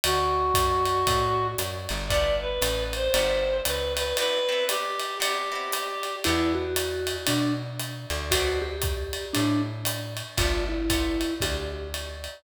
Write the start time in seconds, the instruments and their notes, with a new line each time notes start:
0.04 electric bass (finger) D2, clarinet F#4, ride
0.54 electric bass (finger) F#2, kick, hi-hat pedal, ride
0.85 ride
1.07 electric bass (finger) A2, kick, ride
1.58 electric bass (finger) F#2, hi-hat pedal, ride
1.89 electric bass (finger) G1, ride
2.08 acoustic guitar (steel) A3 B3 F4 G4, clarinet D5, kick, ride
2.41 clarinet B4
2.61 electric bass (finger) A1, hi-hat pedal, ride
2.93 clarinet C5, ride
3.14 electric bass (finger) G1, acoustic guitar (steel) A3 B3 F4 G4, ride
3.65 electric bass (finger) C#2, clarinet B4, hi-hat pedal, ride
3.97 clarinet B4, ride
4.17 acoustic guitar (steel) B3 C4 E4 G4, clarinet B4, ride
4.49 acoustic guitar (steel) B3 C4 E4 G4
4.68 clarinet G4, hi-hat pedal, ride
4.99 ride
5.20 acoustic guitar (steel) B3 C4 E4 G4, clarinet G4, ride
5.52 acoustic guitar (steel) B3 C4 E4 G4
5.72 hi-hat pedal, ride
6.03 ride
6.24 electric bass (finger) E2, acoustic guitar (steel) B3 D4 E4 G4, vibraphone E4, ride
6.55 vibraphone F#4
6.76 hi-hat pedal, ride
7.07 ride
7.27 electric bass (finger) B2, vibraphone D4, ride
7.79 hi-hat pedal, ride
8.10 electric bass (finger) D2, ride
8.31 acoustic guitar (steel) B3 C4 D4 F#4, vibraphone F#4, kick, ride
8.62 vibraphone G4
8.82 kick, hi-hat pedal, ride
9.13 ride
9.33 electric bass (finger) A2, vibraphone D4, ride
9.85 hi-hat pedal, ride
10.17 ride
10.37 electric bass (finger) G1, acoustic guitar (steel) A3 B3 F4 G4, vibraphone F4, kick, ride
10.69 vibraphone E4
10.90 acoustic guitar (steel) A3 B3 F4 G4, kick, hi-hat pedal, ride
11.21 ride
11.40 electric bass (finger) D2, vibraphone G4, kick, ride
11.94 ride
12.24 ride